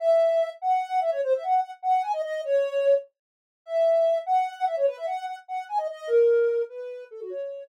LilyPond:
\new Staff { \time 3/4 \key cis \minor \tempo 4 = 148 e''4. fis''4 e''16 cis''16 | bis'16 e''16 fis''8 fis''16 r16 fis''8 gis''16 dis''16 dis''8 | cis''4. r4. | e''4. fis''4 e''16 cis''16 |
b'16 e''16 fis''8 fis''16 r16 fis''8 gis''16 dis''16 dis''8 | ais'4. b'4 a'16 fis'16 | cis''4 r2 | }